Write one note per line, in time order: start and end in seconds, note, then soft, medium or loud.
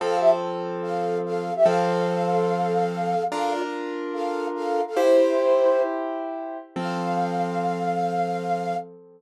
0.00 1.50 F3 loud
0.00 1.50 C4 loud
0.00 0.17 A4 medium
0.00 1.50 A4 loud
0.00 0.17 F5 medium
0.20 0.30 G4 medium
0.20 0.30 E5 medium
0.82 1.18 A4 medium
0.82 1.18 F5 medium
1.25 1.53 A4 medium
1.25 1.53 F5 medium
1.56 1.65 G4 medium
1.56 1.65 E5 medium
1.65 3.14 F3 loud
1.65 3.14 C4 loud
1.65 3.23 A4 medium
1.65 3.14 A4 loud
1.65 3.23 F5 loud
3.31 4.81 D4 loud
3.31 4.81 F4 loud
3.31 3.52 A4 medium
3.31 4.81 A#4 loud
3.31 3.52 F5 loud
3.51 3.61 F4 medium
3.51 3.61 D5 medium
4.13 4.47 A4 medium
4.13 4.47 F5 medium
4.55 4.81 A4 medium
4.55 4.81 F5 medium
4.87 4.97 A4 medium
4.87 4.97 F5 medium
4.96 6.57 E4 loud
4.96 5.82 E4 medium
4.96 6.57 G4 loud
4.96 6.57 C5 loud
4.96 5.82 C5 medium
6.76 8.74 F3 medium
6.76 8.74 C4 loud
6.76 8.74 A4 medium
6.76 8.76 F5 loud